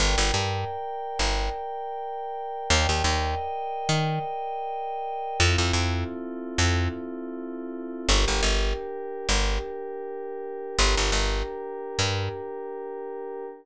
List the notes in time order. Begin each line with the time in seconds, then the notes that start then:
0.00 G1 A#4 D5 G5
0.18 G1
0.34 G2
1.19 G1
2.70 D#2 A#4 D5 D#5 G5
2.89 D#2
3.04 D#2
3.89 D#3
5.40 F2 C4 E4 F4 A4
5.58 F2
5.73 F2
6.58 F2
8.09 G1 D4 G4 A#4
8.28 G1
8.43 G1
9.29 G1
10.78 G1 D4 G4 A#4
10.97 G1
11.12 G1
11.99 G2